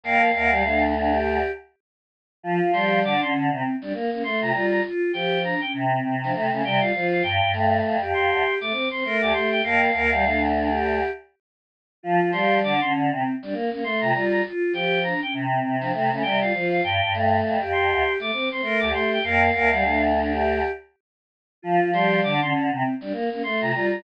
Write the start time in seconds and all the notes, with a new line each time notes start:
0.04 F2 A#3 A#4 F5
0.34 D2 A#3 A#4
0.51 G3 G4
0.64 A3 D4
0.95 D4
1.10 G4
2.43 F3 F4
2.61 F3
2.73 G3 G4 C6
3.03 D3 D4 D6
3.20 D3 C#4 C6
3.34 D3
3.51 C3 C4
3.81 G3 D4
3.94 A#3
4.11 A#3 C#4
4.24 A3 C6
4.40 C3 F4 A#5
4.52 G3 F4
4.71 A#5
4.84 F4
5.13 F3 G4 G5
5.43 D4 A#5
5.61 C#4 G5
5.73 C3
5.90 C4
6.04 C3
6.22 F3 D4
6.33 C3 A3
6.50 C#3 A3 C#4
6.63 C3 G3 G5
6.80 F4 F5
6.94 F3 F4
7.12 F5
7.23 G2 G5
7.41 G2
7.53 A3
7.84 F2
8.01 F2 G4
8.13 F2 C6
8.31 D2
8.61 A3 D6
8.72 C4
8.91 C4 C6
9.04 A3 A#4
9.21 D2 G4 D6
9.33 A3 C6
9.52 G5
9.63 F2 A#3 A#4 F5
9.93 D2 A#3 A#4
10.12 G3 G4
10.24 A3 D4
10.53 D4
10.69 G4
12.03 F3 F4
12.21 F3
12.32 G3 G4 C6
12.63 D3 D4 D6
12.80 D3 C#4 C6
12.93 D3
13.11 C3 C4
13.42 G3 D4
13.53 A#3
13.70 A#3 C#4
13.84 A3 C6
14.00 C3 F4 A#5
14.13 G3 F4
14.31 A#5
14.45 F4
14.73 F3 G4 G5
15.03 D4 A#5
15.21 C#4 G5
15.33 C3
15.51 C4
15.63 C3
15.79 F3 D4
15.93 C3 A3
16.11 C#3 A3 C#4
16.22 C3 G3 G5
16.41 F4 F5
16.53 F3 F4
16.71 F5
16.84 G2 G5
17.01 G2
17.14 A3
17.44 F2
17.61 F2 G4
17.72 F2 C6
17.91 D2
18.19 A3 D6
18.33 C4
18.50 C4 C6
18.62 A3 A#4
18.80 D2 G4 D6
18.92 A3 C6
19.13 G5
19.23 F2 A#3 A#4 F5
19.52 D2 A#3 A#4
19.72 G3 G4
19.82 A3 D4
20.15 D4
20.30 G4
21.62 F3 F4
21.81 F3
21.92 G3 G4 C6
22.23 D3 D4 D6
22.41 D3 C#4 C6
22.54 D3
22.71 C3 C4
23.01 G3 D4
23.12 A#3
23.30 A#3 C#4
23.43 A3 C6
23.59 C3 F4 A#5
23.71 G3 F4
23.90 A#5